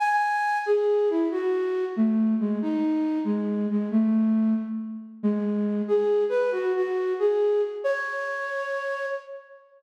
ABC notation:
X:1
M:6/8
L:1/8
Q:3/8=92
K:C#m
V:1 name="Flute"
g3 G2 E | F3 A,2 G, | D3 G,2 G, | A,3 z3 |
G,3 G2 B | F F2 G2 z | c6 |]